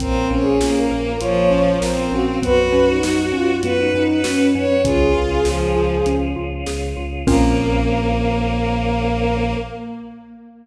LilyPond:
<<
  \new Staff \with { instrumentName = "Flute" } { \time 4/4 \key bes \minor \tempo 4 = 99 \tuplet 3/2 { bes'4 aes'4 bes'4 } des''4 bes'16 bes'16 ges'8 | ces''8. ees'8. f'8. ees'16 ees'8 des'4 | aes'2~ aes'8 r4. | bes'1 | }
  \new Staff \with { instrumentName = "Violin" } { \time 4/4 \key bes \minor c'8 des'8 bes4 f4 c'4 | ges'2 ces''8. ces''8. des''8 | f'4 f4 r2 | bes1 | }
  \new Staff \with { instrumentName = "Xylophone" } { \time 4/4 \key bes \minor c'8 des'8 f'8 bes'8 f'8 des'8 c'8 des'8 | ces'8 des'8 ges'8 des'8 ces'8 des'8 ges'8 des'8 | des'8 f'8 aes'8 f'8 des'8 f'8 aes'8 f'8 | <c' des' f' bes'>1 | }
  \new Staff \with { instrumentName = "Synth Bass 2" } { \clef bass \time 4/4 \key bes \minor bes,,8 bes,,8 bes,,8 bes,,8 bes,,8 bes,,8 bes,,8 bes,,8 | ges,8 ges,8 ges,8 ges,8 ges,8 ges,8 ges,8 ges,8 | des,8 des,8 des,8 des,8 des,8 des,8 des,8 des,8 | bes,,1 | }
  \new Staff \with { instrumentName = "Choir Aahs" } { \time 4/4 \key bes \minor <bes c' des' f'>1 | <ces' des' ges'>1 | <des' f' aes'>1 | <bes c' des' f'>1 | }
  \new DrumStaff \with { instrumentName = "Drums" } \drummode { \time 4/4 <hh bd>4 sn4 hh4 sn4 | <hh bd>4 sn4 hh4 sn4 | <hh bd>4 sn4 hh4 sn4 | <cymc bd>4 r4 r4 r4 | }
>>